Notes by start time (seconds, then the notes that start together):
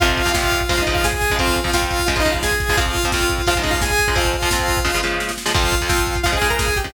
0.00 F2 C3 F3 F4 F5, kick, closed hi-hat
0.09 kick
0.17 kick, closed hi-hat
0.25 F2 C3 F3, kick
0.33 F2 C3 F3 F4 F5, kick, snare
0.43 kick
0.52 kick, closed hi-hat
0.61 kick
0.69 C#3 F3 G#3 F4 F5, kick, closed hi-hat
0.77 C#3 F3 G#3, kick
0.82 D#4 D#5
0.87 C#3 F3 G#3, kick, closed hi-hat
0.94 F4 F5, kick
1.04 G#4 G#5, kick, snare
1.13 kick
1.21 kick, snare, closed hi-hat
1.30 C#3 F3 G#3, kick
1.39 F2 F3 C4 F4 F5, kick, closed hi-hat
1.47 kick
1.56 kick, closed hi-hat
1.64 F2 F3 C4, kick
1.73 F2 F3 C4 F4 F5, kick, snare
1.82 kick
1.91 kick, closed hi-hat
1.99 kick
2.06 C#3 F3 G#3 F4 F5, kick, closed hi-hat
2.16 C#3 F3 G#3 D#4 D#5, kick
2.25 C#3 F3 G#3, kick, closed hi-hat
2.32 F4 F5, kick
2.43 G#4 G#5, kick, snare
2.51 kick
2.60 kick, snare, closed hi-hat
2.69 C#3 F3 G#3, kick
2.77 F2 F3 C4 F4 F5, kick, closed hi-hat
2.86 kick
2.95 kick, closed hi-hat
3.04 F2 F3 C4, kick
3.12 F2 F3 C4 F4 F5, kick, snare
3.21 kick
3.29 kick, closed hi-hat
3.38 kick
3.47 C#3 F3 G#3 F4 F5, kick, closed hi-hat
3.55 C#3 F3 G#3 D#4 D#5, kick
3.63 C#3 F3 G#3, kick, closed hi-hat
3.70 F4 F5, kick
3.82 G#4 G#5, kick, snare
3.90 kick
3.99 kick, snare, closed hi-hat
4.08 C#3 F3 G#3, kick
4.15 F2 F3 C4 F4 F5, kick, closed hi-hat
4.25 kick
4.34 kick, closed hi-hat
4.42 F2 F3 C4, kick
4.51 F2 F3 C4, kick, snare
4.59 kick
4.68 kick, closed hi-hat
4.77 kick
4.84 C#3 F3 G#3, kick, snare
4.94 C#3 F3 G#3
5.03 C#3 F3 G#3, snare
5.20 snare
5.29 snare
5.38 snare
5.46 C#3 F3 G#3, snare
5.54 F2 F3 C4 F4 F5, kick, crash
5.64 kick
5.72 kick, closed hi-hat
5.81 F2 F3 C4, kick
5.89 F2 F3 C4, kick, snare
5.98 kick
6.07 kick, closed hi-hat
6.16 kick
6.23 C#3 F3 G#3 F4 F5, kick, closed hi-hat
6.32 C#3 F3 G#3 G#4 G#5, kick
6.41 C#3 F3 G#3, kick, closed hi-hat
6.50 A#4 A#5, kick
6.59 G#4 G#5, kick, snare
6.68 kick
6.76 G4 G5, kick, snare, closed hi-hat
6.84 C#3 F3 G#3, kick